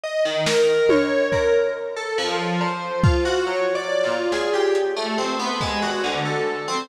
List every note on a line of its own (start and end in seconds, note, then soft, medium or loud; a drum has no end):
0.04 0.23 D#5 medium
0.25 0.44 D#3 medium
0.46 0.85 A#4 loud
0.46 snare loud
0.89 1.28 C#5 medium
0.89 high tom loud
1.32 1.51 A#4 medium
1.32 kick medium
1.96 2.16 A4 medium
2.18 2.56 F3 loud
2.61 2.99 C5 soft
2.61 cowbell loud
3.04 3.23 F4 medium
3.04 kick loud
3.25 3.44 F#4 loud
3.46 3.72 C#5 medium
3.75 4.01 D5 loud
4.04 4.29 F4 medium
4.32 4.51 G#4 medium
4.32 snare medium
4.54 4.73 G4 medium
4.75 closed hi-hat loud
4.96 5.16 A3 medium
5.18 5.37 C4 medium
5.39 5.59 B3 medium
5.61 5.80 G#3 medium
5.61 kick medium
5.82 6.01 F#4 medium
6.04 6.23 D3 medium
6.04 closed hi-hat medium
6.25 6.64 A4 medium
6.68 6.87 C4 loud